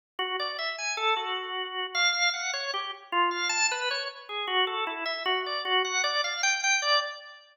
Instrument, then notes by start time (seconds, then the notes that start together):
drawbar organ
0.19 F#4
0.40 D5
0.59 E5
0.78 G#5
0.97 A4
1.17 F#4
1.95 F5
2.34 F#5
2.53 C#5
2.74 G4
3.12 F4
3.31 F5
3.49 A5
3.71 B4
3.91 C#5
4.29 G#4
4.47 F#4
4.67 A4
4.87 E4
5.06 E5
5.25 F#4
5.46 D5
5.65 F#4
5.85 F#5
6.04 D5
6.24 F5
6.43 G5
6.64 G5
6.82 D5